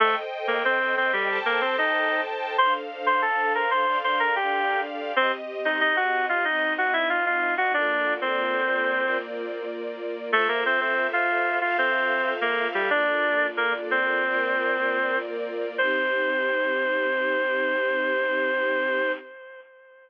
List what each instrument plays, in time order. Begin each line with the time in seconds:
0.00 clarinet A3 A4, string ensemble 1 A4 C5 D#5 G5
0.47 clarinet A#3 A#4
0.65 clarinet C4 C5
0.97 clarinet C4 C5
1.13 clarinet G3 G4
1.28 string ensemble 1 A4 C5 G5 A5
1.45 clarinet A#3 A#4
1.61 clarinet C4 C5
1.78 clarinet D#4 D#5
2.58 string ensemble 1 D4 A4 C5 F5, clarinet C5 C6
3.06 clarinet C5 C6
3.22 clarinet A4 A5
3.55 clarinet A#4 A#5
3.71 clarinet C5 C6
3.86 string ensemble 1 D4 A4 D5 F5
4.04 clarinet C5 C6
4.19 clarinet A#4 A#5
4.36 clarinet G4 G5
5.16 clarinet C4 C5, string ensemble 1 C4 G4 D#5
5.65 clarinet D#4 D#5
5.81 clarinet D#4 D#5
5.96 clarinet F#4 F#5
6.29 clarinet F4 F5
6.45 string ensemble 1 C4 D#4 D#5, clarinet D#4 D#5
6.78 clarinet F#4 F#5
6.93 clarinet E4 E5
7.10 clarinet F4 F5
7.26 clarinet F4 F5
7.58 clarinet F#4 F#5
7.74 string ensemble 1 A#3 F4 A4 D5, clarinet D4 D5
8.21 clarinet C4 C5
9.03 string ensemble 1 A#3 F4 A#4 D5
10.32 clarinet A3 A4, string ensemble 1 F4 A4 C5 E5
10.48 clarinet A#3 A#4
10.66 clarinet C4 C5
10.81 clarinet C4 C5
11.13 clarinet F4 F5
11.61 clarinet F4 F5, string ensemble 1 F4 A4 E5 F5
11.78 clarinet C4 C5
12.41 clarinet A#3 A#4
12.74 clarinet G3 G4
12.90 string ensemble 1 A#3 F4 A4 D5, clarinet D4 D5
13.57 clarinet A#3 A#4
13.91 clarinet C4 C5
14.26 string ensemble 1 A#3 F4 A#4 D5
15.78 string ensemble 1 C4 D#4 G4, clarinet C5